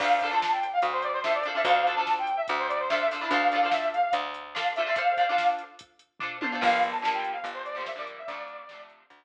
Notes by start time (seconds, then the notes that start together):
0.00 D2 D4 F4 A4 C5 F5, kick, crash
0.21 D4 F4 A4, kick, closed hi-hat
0.25 C5
0.31 D4 F4 A4 C5 A5
0.42 snare
0.52 G5
0.63 closed hi-hat
0.73 F5
0.82 D2, kick, closed hi-hat
0.93 C5
1.02 D5, closed hi-hat
1.13 C5
1.24 D4 F4 A4 C5 E5, snare
1.34 D5
1.43 D4 F4, closed hi-hat
1.48 A4 C5
1.55 D4 F4 A4 C5 E5
1.64 D2 D4 F4 A4 C5 F5, kick, closed hi-hat
1.87 D4 F4 A4 C5, closed hi-hat
1.96 D4 F4 A4 A5
2.00 C5
2.07 snare
2.19 G5
2.27 closed hi-hat
2.37 E5
2.48 D2, kick, closed hi-hat
2.59 C5
2.69 D5, closed hi-hat
2.80 C5
2.89 D4 F4 A4 E5, snare
2.93 C5
3.00 E5
3.11 D4 F4 A4 C5, open hi-hat
3.21 D4 E4 F4 A4 C5
3.31 D2 D4 F4 A4 C5 F5, kick, closed hi-hat
3.52 D4 F4 A4, closed hi-hat
3.56 C5
3.63 D4 F4 A4 C5
3.71 E5, snare
3.93 F5, closed hi-hat
4.12 D2, kick, closed hi-hat
4.34 closed hi-hat
4.55 D4 F4 A4 C5 F5, snare
4.76 D4 F4 A4 E5, closed hi-hat
4.80 C5
4.86 D4 F4 A4 C5
4.95 D4 F4 A4 C5 F5, kick, closed hi-hat
5.17 D4 F4 A4 C5, kick, closed hi-hat
5.29 D4 F4 A4 C5
5.38 snare
5.59 closed hi-hat
5.79 kick, closed hi-hat
5.99 closed hi-hat
6.19 D4 F4 A4 C5, kick, floor tom
6.41 D4 F4 A4 C5, high tom
6.52 D4 F4 A4 C5
6.61 G1 D3 F3 G3 A#3 F5, kick, crash
6.82 kick, closed hi-hat
6.92 A5
7.02 D3 F3 G3 A#3, snare
7.14 G5
7.24 closed hi-hat
7.33 F5
7.43 G1, kick, closed hi-hat
7.54 C5
7.65 D5, closed hi-hat
7.75 D3 F3 G3 A#3 C5
7.86 E5, snare
7.96 D3 F3 G3 A#3 D5
8.07 closed hi-hat
8.18 E5
8.27 D2 C3 D3 D5, kick, closed hi-hat
8.31 F3 A3
8.48 closed hi-hat
8.69 C3 D3 F3, snare
8.73 A3
8.90 closed hi-hat
9.10 D2, kick, closed hi-hat